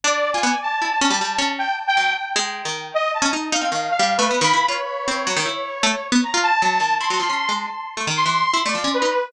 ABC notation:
X:1
M:6/4
L:1/16
Q:1/4=155
K:none
V:1 name="Lead 2 (sawtooth)"
d3 _a3 =a10 g2 z g3 z2 | z6 _e2 a2 z2 f4 (3f4 B4 b4 | _d16 _b2 a6 | c'6 z6 c'5 d3 B4 |]
V:2 name="Harpsichord"
D3 F B, z3 E z _D G, G,2 D3 z3 _G,2 z2 | _A,3 _E,3 z3 _D _E2 E C E,2 z G,2 =A, (3B,2 E,2 =E2 | F z3 C2 _G, _E, =E3 z A, z2 B, z F2 z G,2 _E,2 | E _G, F, _D2 _A,2 z3 =A, _E,2 =E,2 z E A, F, D2 _E z2 |]